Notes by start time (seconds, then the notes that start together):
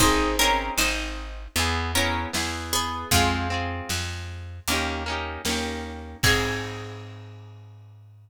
0.00 G#1 C4 D#4 G#4 C5, kick, closed hi-hat
0.39 C4 C#4 D#4 G#4 A#4
0.78 G#1 D#4 C5, snare
1.56 E2 B3 E4 G#4, closed hi-hat
1.95 B3 C#4 E4 G#4 A#4
2.33 E2 B3 E4 G#4, snare
2.73 B3 G#4
3.11 F2 G#3 C4 F4, kick, closed hi-hat
3.16 G#4
3.50 C4 F4 G#4
3.89 F2, snare
4.68 D#2 A#3 C#4, closed hi-hat
4.72 D#4 G4
5.06 A#3 C#4 D#4
5.12 G4
5.45 D#2 A#3 C#4, snare
5.49 D#4 G4
6.23 G#2 C4 D#4 G#4, kick, crash
6.27 G#4